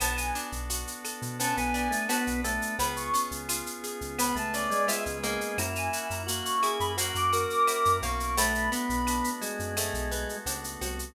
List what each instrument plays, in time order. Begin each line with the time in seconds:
0.00 synth bass 1 B1, drawbar organ B3 D4 F#4 A4, acoustic guitar (steel) B3, clarinet A5, cowbell, claves, shaker
0.16 clarinet G#5, shaker
0.35 acoustic guitar (steel) D4, shaker
0.52 synth bass 1 B1, shaker
0.70 acoustic guitar (steel) F#4, shaker
0.87 shaker
1.05 acoustic guitar (steel) A4, claves, shaker
1.22 synth bass 1 B2, shaker
1.39 drawbar organ B3 C#4 D4 A4 B4, acoustic guitar (steel) B3, clarinet A5, cowbell, shaker
1.57 synth bass 1 B1, drawbar organ B3, clarinet G#5, shaker
1.74 acoustic guitar (steel) D4, clarinet G#5, shaker
1.91 drawbar organ A3, shaker
2.08 drawbar organ B3, acoustic guitar (steel) F#4, clarinet A5, cowbell, claves, shaker
2.27 synth bass 1 B1, shaker
2.44 drawbar organ A3, acoustic guitar (steel) A4, cowbell, shaker
2.62 shaker
2.79 synth bass 1 C#2, drawbar organ B3 C#4 F4 G#4, acoustic guitar (steel) B3, clarinet B5, cowbell, shaker
2.96 clarinet C#6, shaker
3.14 acoustic guitar (steel) C#4, shaker
3.31 synth bass 1 C#2, shaker
3.49 acoustic guitar (steel) F4, claves, shaker
3.66 shaker
3.84 acoustic guitar (steel) G#4, shaker
4.01 synth bass 1 C#2, shaker
4.18 drawbar organ B3 C#4 G#4 B4, acoustic guitar (steel) B3, clarinet B5, cowbell, claves, shaker
4.35 synth bass 1 C#2, drawbar organ A3, clarinet A5, shaker
4.53 acoustic guitar (steel) C#4, clarinet D5, shaker
4.70 drawbar organ G#3, shaker
4.87 drawbar organ G#3, acoustic guitar (steel) F4, clarinet E5, cowbell, shaker
5.06 synth bass 1 C#2, shaker
5.23 drawbar organ G#3, acoustic guitar (steel) A#3, cowbell, shaker
5.41 shaker
5.58 synth bass 1 F#2, drawbar organ A#3 C#4 E4 F#4, clarinet A#5, cowbell, claves, shaker
5.75 clarinet G#5, shaker
5.93 acoustic guitar (steel) F#4, shaker
6.10 synth bass 1 F#2, clarinet A#5, shaker
6.27 acoustic guitar (steel) A#3, drawbar organ F#4, shaker
6.44 clarinet C#6, shaker
6.63 acoustic guitar (steel) E4, drawbar organ G#4, claves, shaker
6.79 synth bass 1 F#2, clarinet B5, shaker
6.97 drawbar organ A#3 C#4 F#4 A#4, acoustic guitar (steel) A#3, clarinet A#5, cowbell, shaker
7.15 synth bass 1 F#2, clarinet D6, shaker
7.32 acoustic guitar (steel) F#4, drawbar organ A#4, shaker
7.49 clarinet D6, shaker
7.67 acoustic guitar (steel) E4, cowbell, claves, shaker
7.85 synth bass 1 F#2, shaker
8.02 synth bass 1 B1, acoustic guitar (steel) A#3, clarinet C#6, cowbell, shaker
8.20 shaker
8.37 drawbar organ A3 B3 D4 F#4, acoustic guitar (steel) A3, clarinet B5, cowbell, shaker
8.55 shaker
8.72 drawbar organ B3, acoustic guitar (steel) B3, shaker
8.89 synth bass 1 B1, shaker
9.07 acoustic guitar (steel) D4, claves, shaker
9.24 shaker
9.41 drawbar organ G#3, acoustic guitar (steel) F#4, shaker
9.59 synth bass 1 F#2, shaker
9.77 acoustic guitar (steel) A3, drawbar organ A3 B3 F#4 A4, cowbell, claves, shaker
9.93 synth bass 1 B1, shaker
10.11 acoustic guitar (steel) B3, shaker
10.29 shaker
10.46 synth bass 1 C#2, acoustic guitar (steel) D4, cowbell, shaker
10.64 shaker
10.81 synth bass 1 C2, acoustic guitar (steel) F#4, cowbell, shaker
10.99 shaker